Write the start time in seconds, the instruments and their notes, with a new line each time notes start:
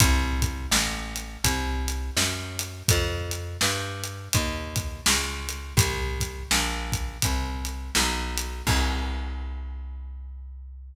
0.00 electric bass (finger) C2, kick, closed hi-hat
0.42 kick, closed hi-hat
0.71 electric bass (finger) A1, snare
1.16 closed hi-hat
1.44 electric bass (finger) C2, kick, closed hi-hat
1.88 closed hi-hat
2.17 electric bass (finger) F#2, snare
2.59 closed hi-hat
2.88 electric bass (finger) F2, kick, closed hi-hat
3.31 closed hi-hat
3.61 electric bass (finger) G2, snare
4.04 closed hi-hat
4.33 electric bass (finger) D#2, kick, closed hi-hat
4.76 kick, closed hi-hat
5.06 electric bass (finger) C#2, snare
5.49 closed hi-hat
5.77 electric bass (finger) C2, kick, closed hi-hat
6.20 kick, closed hi-hat
6.51 electric bass (finger) A#1, snare
6.92 kick, closed hi-hat
7.22 electric bass (finger) C2, kick, closed hi-hat
7.65 closed hi-hat
7.95 electric bass (finger) B1, snare
8.38 closed hi-hat
8.67 electric bass (finger) C2, kick, crash